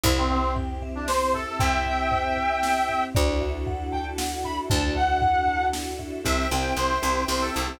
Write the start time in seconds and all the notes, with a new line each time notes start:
0.04 C2 C4 E4 G4 C5, kick, floor tom
0.18 C4
0.30 C4 E5, floor tom
0.56 G5, floor tom
0.82 E5, floor tom
0.95 D4
1.08 C5, snare
1.33 A4 E5, floor tom
1.47 A4
1.59 C2 E5 G5, kick, floor tom
1.85 E5, floor tom
2.11 C5, floor tom
2.37 E5, floor tom
2.63 G5, snare
2.88 E5, floor tom
3.14 D2 D4 E4 F#4 A4 D5, kick, floor tom
3.41 E5, floor tom
3.66 F#5, floor tom
3.92 G5 A5, floor tom
4.18 F#5, snare
4.44 E5 B5, floor tom
4.70 D2 D5 A5, kick, floor tom
4.95 E5 F#5, floor tom
5.22 F#5, floor tom
5.48 A5, floor tom
5.73 F#5, snare
5.99 E5, floor tom
6.24 C2 C4 E4 G4 C5 E5 G5, kick, closed hi-hat
6.51 C2 C4 E4 G4 G5, closed hi-hat
6.77 C2 C5, closed hi-hat
7.02 C2 C4 E4 G4, closed hi-hat
7.28 C2 C4 E4 G4 C5, snare
7.41 A4
7.54 C2 A4, closed hi-hat
7.68 C4 E4 G4